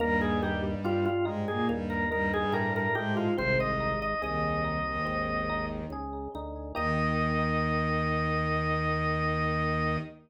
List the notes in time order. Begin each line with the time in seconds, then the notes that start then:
0.00 D#2 G2 G3 A#3 A#4
0.21 G#4
0.42 D#4 G4
0.84 G2 F4 G4
1.05 F4
1.25 G#2 G#3 D#4
1.48 A#2 A#3 G#4
1.69 D#2 G2 G3 A#3
1.90 A#4
2.11 G2 G3 D#4 A#4
2.34 G2 G3 G#4
2.52 A2 G4 A#4
2.76 A#4
2.95 G#2 G#3 D#4 G4
3.17 F4
3.36 G#1 C2 C3 C4 C5
3.58 C2 C3 D#5
3.80 D#4
4.02 D#5
4.22 C2 D#2 D#3 G#4 D#5
4.64 D#4
4.86 D#2 D#3
5.05 G#1 C4
5.49 D#4
5.90 C#2 G#4
6.35 D2 D#4
6.75 D#2 D#3 A#3 D#4 G4 D#5